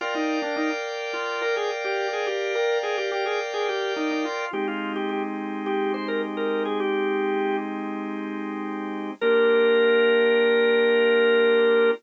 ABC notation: X:1
M:4/4
L:1/16
Q:1/4=106
K:Bbmix
V:1 name="Drawbar Organ"
F E2 D E z3 F2 B A z G2 A | G2 B2 A G G A z A G2 E E F2 | G F2 G G z3 G2 c B z B2 A | "^rit." G6 z10 |
B16 |]
V:2 name="Drawbar Organ"
[Bdfg]16- | [Bdfg]16 | [A,CEG]16- | "^rit." [A,CEG]16 |
[B,DFG]16 |]